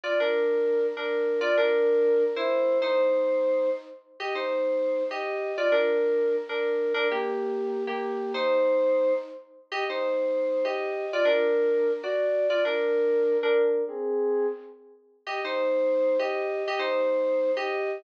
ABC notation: X:1
M:9/8
L:1/8
Q:3/8=130
K:Eb
V:1 name="Electric Piano 2"
[Fd] [DB]5 [DB]3 | [Fd] [DB]5 [=Ec]3 | [Ec]6 z3 | [Ge] [Ec]5 [Ge]3 |
[Fd] [DB]5 [DB]3 | [DB] [B,G]5 [B,G]3 | [Ec]6 z3 | [Ge] [Ec]5 [Ge]3 |
[Fd] [DB]5 [^Fd]3 | [Fd] [DB]5 [DB]3 | [CA]4 z5 | [Ge] [Ec]5 [Ge]3 |
[Ge] [Ec]5 [Ge]3 |]